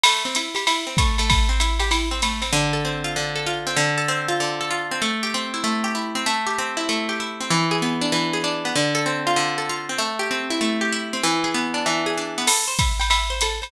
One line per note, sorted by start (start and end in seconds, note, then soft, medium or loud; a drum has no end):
0.03 0.23 A3 medium
0.03 ride loud
0.25 0.35 C4 medium
0.35 0.54 E4 medium
0.35 hi-hat pedal medium
0.35 ride medium
0.55 0.65 G4 medium
0.55 ride medium
0.67 0.85 E4 medium
0.67 ride loud
0.87 0.97 C4 medium
0.97 1.17 A3 medium
0.97 kick medium
0.97 hi-hat pedal medium
0.97 ride medium
1.18 1.48 A3 medium
1.18 ride medium
1.30 kick medium
1.30 ride loud
1.49 1.59 C4 medium
1.60 1.78 E4 medium
1.60 hi-hat pedal medium
1.60 ride medium
1.79 1.90 G4 medium
1.79 ride medium
1.91 2.09 E4 medium
1.91 ride medium
2.11 2.21 C4 medium
2.22 2.41 A3 medium
2.22 hi-hat pedal medium
2.22 ride medium
2.42 2.51 C4 medium
2.42 ride medium
2.53 3.16 D3 loud
2.73 3.35 A4 medium
2.85 3.66 C4 medium
3.04 3.46 F4 medium
3.16 3.76 D3 medium
3.35 3.76 A4 medium
3.46 3.76 F4 medium
3.67 3.77 C4 medium
3.76 4.40 D3 loud
3.98 4.60 A4 medium
4.08 4.91 C4 medium
4.28 4.70 F4 medium
4.40 5.00 D3 medium
4.61 5.01 A4 medium
4.71 5.01 F4 medium
4.91 5.02 C4 medium
5.02 5.63 A3 loud
5.23 5.83 G4 medium
5.34 6.15 C4 medium
5.54 5.94 E4 medium
5.64 6.24 A3 loud
5.84 6.24 G4 medium
5.95 6.25 E4 medium
6.15 6.26 C4 medium
6.26 6.88 A3 loud
6.47 7.08 G4 medium
6.58 7.40 C4 medium
6.77 7.19 E4 medium
6.89 7.49 A3 medium
7.09 7.49 G4 medium
7.20 7.50 E4 medium
7.40 7.51 C4 medium
7.50 8.12 E3 loud
7.71 8.33 G#4 medium
7.82 8.65 B3 medium
8.01 8.43 D4 medium
8.12 8.72 E3 medium
8.33 8.74 G#4 medium
8.44 8.74 D4 medium
8.65 8.75 B3 medium
8.76 9.36 D3 loud
8.95 9.57 A4 loud
9.06 9.89 C4 medium
9.27 9.69 F4 medium
9.36 9.96 D3 medium
9.58 9.98 A4 medium
9.69 9.99 F4 medium
9.89 10.00 C4 medium
9.98 10.60 A3 loud
10.19 10.81 G4 medium
10.31 11.13 C4 medium
10.50 10.92 E4 medium
10.61 11.21 A3 medium
10.81 11.21 G4 medium
10.92 11.22 E4 medium
11.13 11.24 C4 medium
11.23 11.85 E3 loud
11.44 12.06 G#4 medium
11.54 12.37 B3 medium
11.74 12.17 D4 medium
11.86 12.46 E3 medium
12.06 12.47 G#4 medium
12.17 12.47 D4 medium
12.38 12.48 B3 medium
12.47 12.65 A4 medium
12.47 crash loud
12.47 ride loud
12.68 12.77 C5 medium
12.79 12.98 E5 medium
12.79 kick medium
12.79 hi-hat pedal medium
12.79 ride medium
13.00 13.09 G5 medium
13.00 ride medium
13.10 13.28 E5 medium
13.10 ride loud
13.30 13.40 C5 medium
13.41 13.60 A4 medium
13.41 hi-hat pedal loud
13.41 ride medium
13.62 13.71 C5 medium
13.62 ride medium